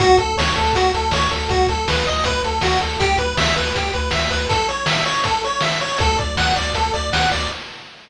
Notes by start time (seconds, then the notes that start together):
0.00 D2 F#4, kick, closed hi-hat
0.17 D2 A4, kick, closed hi-hat
0.37 D2 C#5, snare
0.56 D2 A4, closed hi-hat
0.73 D2 F#4, kick, closed hi-hat
0.94 D2 A4, closed hi-hat
1.11 D2 C#5, snare
1.31 D2 A4, closed hi-hat
1.49 D2 F#4, kick, closed hi-hat
1.67 D2 A4, kick, closed hi-hat
1.88 D2 B4, snare
2.07 D2 D#5, closed hi-hat
2.24 D2 B4, kick, closed hi-hat
2.44 D2 A4, closed hi-hat
2.61 D2 F#4, snare
2.81 D2 A4, closed hi-hat
3.00 D2 G4, kick, closed hi-hat
3.18 D2 B4, kick, closed hi-hat
3.37 D2 E5, snare
3.56 D2 B4, closed hi-hat
3.75 D2 G4, kick, closed hi-hat
3.93 D2 B4, closed hi-hat
4.11 D2 E5, snare
4.30 D2 B4, closed hi-hat
4.49 A4, kick, closed hi-hat
4.69 C#5, closed hi-hat
4.86 E5, snare
5.06 C#5, closed hi-hat
5.24 A4, kick, closed hi-hat
5.44 C#5, closed hi-hat
5.61 E5, snare
5.81 C#5, closed hi-hat
5.98 D2 A4, kick, closed hi-hat
6.17 D2 D5, kick, closed hi-hat
6.37 D2 F#5, snare
6.56 D2 D5, closed hi-hat
6.73 D2 A4, kick, closed hi-hat
6.93 D2 D5, closed hi-hat
7.11 D2 F#5, snare
7.31 D2 D5, closed hi-hat